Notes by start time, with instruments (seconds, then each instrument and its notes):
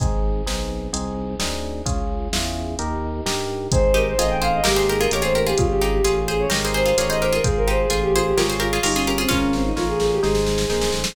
0.00 drawbar organ G#1, electric piano 1 C4 D#4 G#4, kick, closed hi-hat
0.46 drawbar organ B1, electric piano 1 C4 D#4 G#4, snare
0.93 drawbar organ C2, electric piano 1 C4 D#4 G#4, closed hi-hat
1.39 drawbar organ D2, electric piano 1 C4 D#4 G#4, snare
1.85 drawbar organ C#2, electric piano 1 C#4 F4 G#4, kick, closed hi-hat
2.33 drawbar organ E2, electric piano 1 C#4 F4 G#4, snare
2.79 drawbar organ D#2, electric piano 1 D#4 G4 A#4, closed hi-hat
3.26 drawbar organ G2, electric piano 1 D#4 G4 A#4, snare
3.72 drawbar organ G#1, electric piano 1 C4 D#4 G#4, violin C5, kick, closed hi-hat
3.94 harpsichord D#4 G4, violin A#4
4.07 violin C5
4.18 drawbar organ A1, electric piano 1 C4 D#4 G#4, harpsichord F4 G#4, violin D#5, closed hi-hat
4.30 violin G5
4.42 harpsichord G#4 C5, violin F5
4.54 violin D#5
4.64 drawbar organ G#1, electric piano 1 A#3 D#4 G4, harpsichord G4 A#4, violin G4, snare
4.76 harpsichord G#4 C5
4.89 harpsichord G4 A#4, violin G#4
5.00 harpsichord F4 G#4, violin A#4
5.11 drawbar organ A1, electric piano 1 A#3 D#4 G4, harpsichord G4 A#4, violin C#5, closed hi-hat
5.22 harpsichord F4 G#4, violin C5
5.35 harpsichord G4 A#4, violin A#4
5.47 harpsichord F4 G#4, violin G4
5.57 drawbar organ G#1, electric piano 1 C#4 F4 G#4, violin F4, kick, closed hi-hat
5.69 violin G4
5.81 harpsichord D#4 G4, violin G#4
5.93 violin G4
6.04 drawbar organ A1, electric piano 1 C#4 F4 G#4, harpsichord F4 G#4, closed hi-hat
6.28 harpsichord G#4 C5, violin G#4
6.40 violin C#5
6.50 drawbar organ G#1, electric piano 1 D#4 G4 A#4, harpsichord G4 A#4, snare
6.65 harpsichord G#4 C5
6.74 harpsichord G#4 C5, violin C5
6.86 harpsichord F4 G#4
6.97 drawbar organ A1, electric piano 1 D#4 G4 A#4, harpsichord F4 G#4, violin C#5, closed hi-hat
7.09 harpsichord G#4 C5, violin D#5
7.20 harpsichord G4 A#4, violin C5
7.33 harpsichord F4 G#4, violin A#4
7.44 drawbar organ G#1, electric piano 1 F4 G#4 C5, violin G#4, kick, closed hi-hat
7.57 violin A#4
7.68 harpsichord D#4 G4, violin C5
7.79 violin G#4
7.90 drawbar organ A1, harpsichord F4 G#4, electric piano 1 F4 G#4 C5, closed hi-hat
8.02 violin G4
8.13 violin F4, harpsichord G#4 C5
8.25 violin G4
8.36 drawbar organ G#1, violin F4, electric piano 1 F4 G#4 C#5, harpsichord G4 A#4, snare
8.50 harpsichord G#4 C5
8.59 violin F4, harpsichord G4 A#4
8.73 harpsichord F4 G#4
8.83 drawbar organ G1, violin D#4, electric piano 1 F4 G#4 C#5, harpsichord G4 A#4, open hi-hat
8.94 violin C#4, harpsichord F4 G#4
9.06 violin C#4, harpsichord G4 A#4
9.18 violin C4, harpsichord F4 G#4
9.29 drawbar organ G#1, harpsichord C#4 F4, violin C#4, electric piano 1 F4 A#4 C#5, kick, snare
9.53 violin C4, snare
9.65 violin D#4
9.76 drawbar organ A1, electric piano 1 F4 A#4 C#5, violin F4, snare
9.88 violin G#4
10.00 violin G#4, snare
10.12 violin G4
10.23 drawbar organ G#1, electric piano 1 D#4 G#4 C5, violin G#4, snare
10.35 snare
10.47 snare
10.58 snare
10.69 drawbar organ A#1, electric piano 1 D#4 G#4 C5, snare
10.81 snare
10.92 drawbar organ A1, snare
11.04 snare